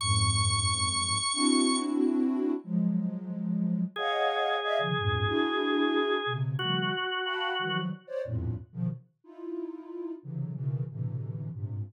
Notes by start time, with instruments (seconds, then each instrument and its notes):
0.00 ocarina F2 F#2 G#2, drawbar organ C#6
1.33 ocarina C4 D4 E4 F#4
2.64 ocarina F3 F#3 G#3
3.96 drawbar organ G#4, ocarina C#5 D#5 F5 F#5
4.63 ocarina D5 D#5 E5 F5
4.79 ocarina C3 C#3 D3 D#3 F3
4.97 ocarina E2 F2 G2 G#2 A#2
5.27 ocarina D4 E4 F#4 G#4
6.26 ocarina B2 C3 C#3
6.59 ocarina C#3 D#3 F3 G3 A3, drawbar organ F#4
7.24 ocarina F5 F#5 G5 A5 B5
7.59 ocarina D#3 E3 F3 F#3 G3
8.07 ocarina C5 C#5 D5
8.25 ocarina E2 F2 G2 A2 A#2
8.73 ocarina B2 C#3 D#3 F3
9.24 ocarina D#4 E4 F4
10.23 ocarina C3 C#3 D3 E3 F#3
10.54 ocarina B2 C#3 D#3 E3
10.90 ocarina A2 B2 C3 D3 E3
11.53 ocarina G2 G#2 A#2 C3